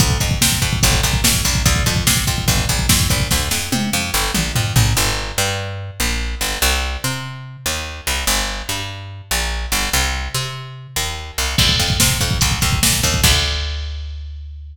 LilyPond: <<
  \new Staff \with { instrumentName = "Electric Bass (finger)" } { \clef bass \time 4/4 \key d \minor \tempo 4 = 145 d,8 f,8 c8 f,8 g,,8 bes,,8 f,8 bes,,8 | d,8 f,8 c8 f,8 g,,8 bes,,8 f,8 bes,,8 | d,8 f,8 c8 f,8 g,,8 bes,,8 f,8 bes,,8 | \key g \minor g,,4 g,4. bes,,4 g,,8 |
c,4 c4. ees,4 c,8 | g,,4 g,4. bes,,4 g,,8 | c,4 c4. ees,4 c,8 | \key d \minor d,8 f,8 c8 f,8 c,8 ees,8 bes,8 ees,8 |
d,1 | }
  \new DrumStaff \with { instrumentName = "Drums" } \drummode { \time 4/4 <hh bd>16 bd16 <hh bd>16 bd16 <bd sn>16 bd16 <hh bd>16 bd16 <hh bd>16 bd16 <hh bd>16 bd16 <bd sn>16 bd16 <hho bd>16 bd16 | <hh bd>16 bd16 <hh bd>16 bd16 <bd sn>16 bd16 <hh bd>16 bd16 <hh bd>16 bd16 <hh bd>16 bd16 <bd sn>16 bd16 <hh bd>16 bd16 | <bd sn>8 sn8 tommh4 r8 toml8 tomfh8 tomfh8 | r4 r4 r4 r4 |
r4 r4 r4 r4 | r4 r4 r4 r4 | r4 r4 r4 r4 | <cymc bd>16 bd16 <hh bd>16 bd16 <bd sn>16 bd16 <hh bd>16 bd16 <hh bd>16 bd16 <hh bd>16 bd16 <bd sn>16 bd16 <hho bd>16 bd16 |
<cymc bd>4 r4 r4 r4 | }
>>